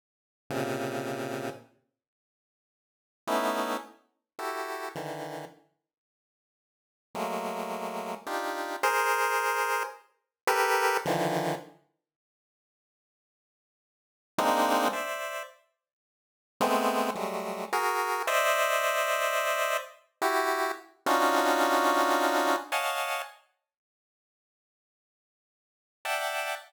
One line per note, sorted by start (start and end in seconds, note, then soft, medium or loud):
0.50 1.50 A#2 medium
0.50 1.50 C3 medium
0.50 1.50 C#3 medium
3.27 3.77 A3 medium
3.27 3.77 B3 medium
3.27 3.77 C#4 medium
3.27 3.77 D#4 medium
3.27 3.77 E4 medium
4.39 4.89 E4 soft
4.39 4.89 F#4 soft
4.39 4.89 G4 soft
4.39 4.89 A4 soft
4.95 5.45 D3 soft
4.95 5.45 D#3 soft
4.95 5.45 E3 soft
7.15 8.15 F#3 medium
7.15 8.15 G#3 medium
7.15 8.15 A3 medium
7.15 8.15 A#3 medium
8.27 8.77 D4 medium
8.27 8.77 D#4 medium
8.27 8.77 F4 medium
8.27 8.77 G4 medium
8.83 9.83 G#4 loud
8.83 9.83 A#4 loud
8.83 9.83 C5 loud
10.47 10.97 G4 loud
10.47 10.97 A4 loud
10.47 10.97 A#4 loud
10.47 10.97 B4 loud
11.05 11.55 D3 medium
11.05 11.55 D#3 medium
11.05 11.55 E3 medium
11.05 11.55 F3 medium
14.38 14.88 G#3 loud
14.38 14.88 A#3 loud
14.38 14.88 C4 loud
14.38 14.88 D4 loud
14.38 14.88 D#4 loud
14.93 15.43 C5 medium
14.93 15.43 D5 medium
14.93 15.43 E5 medium
16.61 17.11 G#3 loud
16.61 17.11 A3 loud
16.61 17.11 B3 loud
16.61 17.11 C4 loud
17.15 17.65 F#3 medium
17.15 17.65 G3 medium
17.15 17.65 G#3 medium
17.15 17.65 A3 medium
17.73 18.23 F#4 medium
17.73 18.23 G#4 medium
17.73 18.23 A#4 medium
18.27 19.77 C5 loud
18.27 19.77 D5 loud
18.27 19.77 D#5 loud
18.27 19.77 E5 loud
20.22 20.72 E4 medium
20.22 20.72 F#4 medium
20.22 20.72 G4 medium
21.06 22.56 C#4 loud
21.06 22.56 D4 loud
21.06 22.56 D#4 loud
21.06 22.56 F4 loud
21.06 22.56 F#4 loud
22.72 23.22 C#5 medium
22.72 23.22 D#5 medium
22.72 23.22 F5 medium
22.72 23.22 F#5 medium
22.72 23.22 G#5 medium
22.72 23.22 A5 medium
26.05 26.55 D5 medium
26.05 26.55 E5 medium
26.05 26.55 F#5 medium
26.05 26.55 G5 medium
26.05 26.55 A5 medium